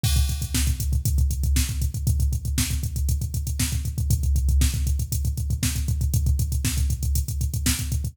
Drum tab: CC |x---------------|----------------|----------------|----------------|
HH |-xxx-xxxxxxx-xxx|xxxx-xxxxxxx-xxx|xxxx-xxxxxxx-xxx|xxxx-xxxxxxx-xxx|
SD |----o-------o---|----o-------o---|----o-------o---|----o-------o---|
BD |oooooooooooooooo|oooooooooooooooo|oooooooooooooooo|oooooooooooooooo|